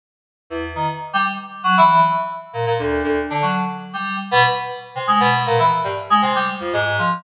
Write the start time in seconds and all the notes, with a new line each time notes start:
0.50 E2
0.75 D#3
1.13 G3
1.64 F#3
1.77 E3
2.53 A#2
2.66 A#2
2.79 D2
3.04 D2
3.30 D3
3.42 F#3
3.93 G3
4.31 B2
4.95 C3
5.07 G#3
5.20 B2
5.46 A#2
5.59 E3
5.84 G2
6.10 G#3
6.22 C3
6.35 G3
6.60 F2
6.73 G#2
6.99 F3